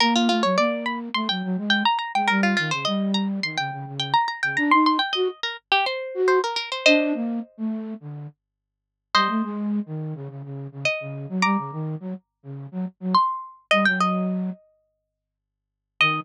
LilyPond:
<<
  \new Staff \with { instrumentName = "Harpsichord" } { \time 4/4 \key ees \mixolydian \tempo 4 = 105 bes'16 f'16 f'16 cis''16 d''8 b''16 r16 c'''16 g''8. g''16 bes''16 bes''16 g''16 | bes'16 f'16 f'16 c''16 ees''8 bes''16 r16 c'''16 g''8. g''16 bes''16 bes''16 g''16 | bes''16 c'''16 c'''16 g''16 ees''8 bes'16 r16 g'16 c''8. c''16 bes'16 bes'16 c''16 | <c'' ees''>2~ <c'' ees''>8 r4. |
<c'' ees''>2. ees''4 | <bes'' d'''>2. c'''4 | ees''16 g''16 ees''2~ ees''8 r4 | ees''4 r2. | }
  \new Staff \with { instrumentName = "Flute" } { \time 4/4 \key ees \mixolydian bes8 a16 ges16 bes4 a16 ges16 ges16 aes8 r8 aes16 | g8 ees16 des16 g4 ees16 des16 des16 des8 r8 des16 | d'16 ees'8 r16 ges'16 r4. ges'8 r8. | d'8 bes8 r16 a8. d8 r4. |
g16 a16 aes8. ees8 des16 des16 des8 des16 r16 des8 ges16 | g16 des16 ees8 ges16 r8 des8 ges16 r16 ges16 r4 | g16 ges4~ ges16 r2 r8 | ees4 r2. | }
>>